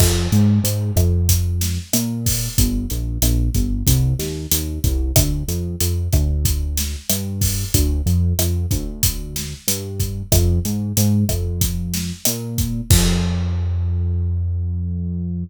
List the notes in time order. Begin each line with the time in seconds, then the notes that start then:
0.00 F2, kick, cross-stick, crash
0.32 G#2, closed hi-hat
0.64 G#2, closed hi-hat
0.96 F2, kick, cross-stick, closed hi-hat
1.29 kick, closed hi-hat
1.61 snare, closed hi-hat
1.93 A#2, cross-stick, closed hi-hat
2.26 kick, open hi-hat
2.58 G1, kick, closed hi-hat
2.90 A#1, closed hi-hat
3.22 A#1, cross-stick, closed hi-hat
3.54 G1, kick, closed hi-hat
3.87 C2, kick, closed hi-hat
4.19 D#2, snare, closed hi-hat
4.51 D#2, closed hi-hat
4.84 C2, kick, closed hi-hat
5.16 D2, kick, cross-stick, closed hi-hat
5.48 F2, closed hi-hat
5.80 F2, closed hi-hat
6.12 D2, kick, cross-stick, closed hi-hat
6.45 kick, closed hi-hat
6.77 snare, closed hi-hat
7.10 G2, cross-stick, closed hi-hat
7.41 kick, open hi-hat
7.74 D2, kick, closed hi-hat
8.06 F2, closed hi-hat
8.39 F2, cross-stick, closed hi-hat
8.71 D2, kick, closed hi-hat
9.03 kick, closed hi-hat
9.36 snare, closed hi-hat
9.68 G2, closed hi-hat
10.00 kick, closed hi-hat
10.32 F2, kick, cross-stick, closed hi-hat
10.65 G#2, closed hi-hat
10.97 G#2, closed hi-hat
11.29 F2, kick, cross-stick, closed hi-hat
11.61 kick, closed hi-hat
11.94 snare, closed hi-hat
12.25 A#2, cross-stick, closed hi-hat
12.58 kick, closed hi-hat
12.90 F2, kick, crash